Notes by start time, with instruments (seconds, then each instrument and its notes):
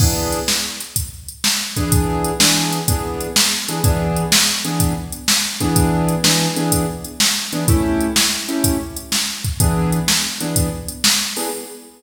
0.00 acoustic grand piano E3 B3 D4 G#4, kick, crash
0.33 closed hi-hat
0.48 snare
0.81 closed hi-hat
0.96 kick, closed hi-hat
1.28 closed hi-hat
1.44 snare
1.76 acoustic grand piano E3 B3 D4 G#4, kick, closed hi-hat
1.92 kick, closed hi-hat
2.25 closed hi-hat
2.40 acoustic grand piano E3 B3 D4 G#4, snare
2.72 closed hi-hat
2.88 acoustic grand piano E3 B3 D4 G#4, kick, closed hi-hat
3.21 closed hi-hat
3.36 snare
3.69 acoustic grand piano E3 B3 D4 G#4, closed hi-hat
3.84 acoustic grand piano E3 B3 D4 G#4, kick, closed hi-hat
4.17 closed hi-hat
4.32 snare
4.65 acoustic grand piano E3 B3 D4 G#4, closed hi-hat
4.80 kick, closed hi-hat
5.12 closed hi-hat
5.28 snare
5.61 acoustic grand piano E3 B3 D4 G#4, kick, closed hi-hat
5.76 kick, closed hi-hat
6.08 closed hi-hat
6.24 acoustic grand piano E3 B3 D4 G#4, snare
6.56 acoustic grand piano E3 B3 D4 G#4, closed hi-hat
6.72 kick, closed hi-hat
7.04 closed hi-hat
7.20 snare
7.53 acoustic grand piano E3 B3 D4 G#4, closed hi-hat
7.68 acoustic grand piano A3 C#4 E4 G4, kick, closed hi-hat
8.01 closed hi-hat
8.16 snare
8.48 acoustic grand piano A3 C#4 E4 G4, closed hi-hat
8.64 kick, closed hi-hat
8.96 closed hi-hat
9.12 snare
9.45 kick, closed hi-hat
9.60 acoustic grand piano E3 B3 D4 G#4, kick, closed hi-hat
9.93 closed hi-hat
10.08 snare
10.40 acoustic grand piano E3 B3 D4 G#4, closed hi-hat
10.56 kick, closed hi-hat
10.88 closed hi-hat
11.04 snare
11.37 acoustic grand piano E3 B3 D4 G#4, open hi-hat